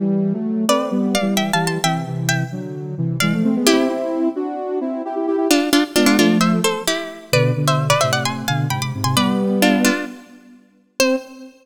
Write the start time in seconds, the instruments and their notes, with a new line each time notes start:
0.00 ocarina E3 G3
0.33 ocarina F#3 A3
0.68 ocarina A3 C4, harpsichord B4 D5
0.91 ocarina G3 B3
1.15 harpsichord D5 F5
1.21 ocarina E3 G3
1.37 harpsichord E5 G5
1.53 ocarina E3 G3, harpsichord F5 A5
1.67 harpsichord A5 C6
1.84 ocarina C3 E3, harpsichord E5 G5
2.07 ocarina C3 E3
2.29 harpsichord E5 G5
2.52 ocarina D3 F#3
2.98 ocarina C3 E3
3.20 ocarina E3 G#3, harpsichord D5 F5
3.33 ocarina F3 A3
3.44 ocarina A3 C4
3.56 ocarina G#3 B3
3.66 ocarina C4 E4, harpsichord E4 G4
3.89 ocarina C4 E4
4.36 ocarina D4 F#4
4.81 ocarina C4 E4
5.05 ocarina E4 G4
5.15 ocarina E4 G4
5.27 ocarina E4 G4
5.37 ocarina E4 G4
5.50 harpsichord D4 F4
5.73 harpsichord D4 F4
5.96 ocarina G#3 B3, harpsichord D4 F4
6.06 harpsichord D4 F4
6.19 ocarina F3 A3, harpsichord D4 F4
6.41 harpsichord C5 E5
6.64 harpsichord A4 C5
6.87 harpsichord E4 G4
7.32 ocarina B2 D3, harpsichord B4 D5
7.56 ocarina B2 D3
7.67 harpsichord C5 E5
7.90 harpsichord B4 D5
8.01 ocarina A2 C3, harpsichord C5 E5
8.12 harpsichord D5 F#5
8.25 harpsichord G#5 C6
8.48 ocarina B2 D3, harpsichord F5 G#5
8.70 ocarina G#2 C3, harpsichord G5 B5
8.81 ocarina G#2 C3, harpsichord B5 D6
8.94 ocarina G#2 C3
9.04 ocarina G#2 C3, harpsichord G#5 C6
9.16 ocarina G3 B3, harpsichord B4 D5
9.62 harpsichord D4 F4
9.84 harpsichord D4 F4
11.00 ocarina C4, harpsichord C5